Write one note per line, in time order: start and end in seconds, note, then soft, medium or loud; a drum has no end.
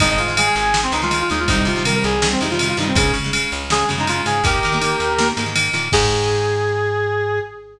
0.00 0.18 G#1 medium
0.00 0.22 D#3 loud
0.00 0.22 G#3 medium
0.00 0.09 D#4 loud
0.00 kick loud
0.00 ride loud
0.09 0.18 D#4 loud
0.18 0.49 G#2 medium
0.18 0.36 F4 medium
0.18 ride medium
0.28 0.35 D#3 medium
0.28 0.35 G#3 medium
0.37 0.67 D#3 medium
0.37 0.67 G#3 medium
0.37 0.45 G#4 medium
0.37 ride loud
0.46 0.54 G#4 loud
0.55 0.87 G#1 medium
0.55 0.80 G#4 medium
0.55 ride medium
0.74 0.89 D#3 medium
0.74 0.89 G#3 medium
0.74 snare loud
0.83 0.92 C4 medium
0.92 1.23 C#2 medium
0.92 1.00 D#3 medium
0.92 1.00 G#3 medium
0.92 1.01 D#4 loud
0.92 ride medium
1.02 1.09 D#3 medium
1.02 1.09 G#3 medium
1.02 1.19 F4 loud
1.11 1.26 D#3 medium
1.11 1.26 G#3 medium
1.11 ride medium
1.20 1.29 F4 medium
1.30 1.47 D#2 medium
1.30 1.45 D#3 medium
1.30 1.45 G#3 medium
1.30 1.39 D#4 loud
1.30 ride medium
1.39 1.48 F4 medium
1.48 1.64 C2 medium
1.48 1.70 C3 medium
1.48 1.70 D#3 loud
1.48 1.70 G3 medium
1.48 1.57 D#4 loud
1.48 kick loud
1.48 ride loud
1.57 1.66 D#4 loud
1.65 1.97 C3 medium
1.65 1.83 F4 medium
1.65 ride medium
1.76 1.83 C3 medium
1.76 1.83 D#3 medium
1.76 1.83 G3 medium
1.85 2.15 C3 medium
1.85 2.15 D#3 medium
1.85 2.15 G3 medium
1.85 1.94 A#4 medium
1.85 ride loud
1.95 2.03 A#4 loud
2.04 2.36 C2 medium
2.04 2.28 G#4 loud
2.04 ride medium
2.22 2.37 C3 medium
2.22 2.37 D#3 medium
2.22 2.37 G3 medium
2.22 snare loud
2.31 2.40 C4 loud
2.41 2.73 F2 medium
2.41 2.48 C3 medium
2.41 2.48 D#3 medium
2.41 2.48 G3 medium
2.41 2.50 D#4 medium
2.41 ride medium
2.50 2.58 C3 medium
2.50 2.58 D#3 medium
2.50 2.58 G3 medium
2.50 2.68 F4 medium
2.59 2.74 C3 medium
2.59 2.74 D#3 medium
2.59 2.74 G3 medium
2.59 ride loud
2.69 2.77 F4 loud
2.77 2.93 G2 medium
2.77 2.93 C3 medium
2.77 2.93 D#3 medium
2.77 2.87 D#4 medium
2.77 ride medium
2.81 2.93 G3 medium
2.87 2.96 C4 medium
2.95 3.11 C#2 medium
2.95 3.19 C#3 loud
2.95 3.19 G#3 medium
2.95 3.12 G#4 loud
2.95 kick loud
2.95 ride loud
3.14 3.45 C#3 medium
3.14 ride medium
3.24 3.31 C#3 medium
3.24 3.31 G#3 medium
3.33 3.63 C#3 medium
3.33 3.63 G#3 medium
3.33 ride loud
3.52 3.84 C#2 medium
3.52 ride medium
3.70 3.85 C#3 medium
3.70 3.85 G#3 medium
3.70 3.89 G#4 loud
3.70 snare loud
3.89 4.21 F#2 medium
3.89 3.96 C#3 medium
3.89 3.96 G#3 medium
3.89 ride medium
3.98 4.06 C#3 medium
3.98 4.06 G#3 medium
3.98 4.08 D#4 medium
4.07 4.22 C#3 medium
4.07 4.22 G#3 medium
4.07 4.25 F4 medium
4.07 ride medium
4.26 4.42 G#2 medium
4.26 4.41 C#3 medium
4.26 4.41 G#3 medium
4.26 4.43 G#4 loud
4.26 ride medium
4.44 4.59 D#2 medium
4.44 4.67 D#3 loud
4.44 4.67 A#3 loud
4.44 5.27 G4 loud
4.44 5.27 A#4 loud
4.44 kick loud
4.44 ride loud
4.63 4.96 D#3 medium
4.63 ride medium
4.72 4.80 D#3 medium
4.72 4.80 A#3 medium
4.81 5.11 D#3 medium
4.81 5.11 A#3 medium
4.81 ride loud
5.00 5.31 D#2 medium
5.00 ride medium
5.19 5.33 D#3 medium
5.19 5.33 A#3 medium
5.19 snare loud
5.37 5.68 G#2 medium
5.37 5.45 D#3 medium
5.37 5.45 A#3 medium
5.37 ride medium
5.46 5.54 D#3 medium
5.46 5.54 A#3 medium
5.55 5.70 D#3 medium
5.55 5.70 A#3 medium
5.55 ride loud
5.73 5.89 A#2 medium
5.73 5.89 D#3 medium
5.73 5.89 A#3 medium
5.73 ride medium
5.92 7.40 G#2 loud
5.92 7.39 D#3 loud
5.92 7.39 G#3 loud
5.92 7.39 G#4 loud
5.92 kick loud
5.92 crash loud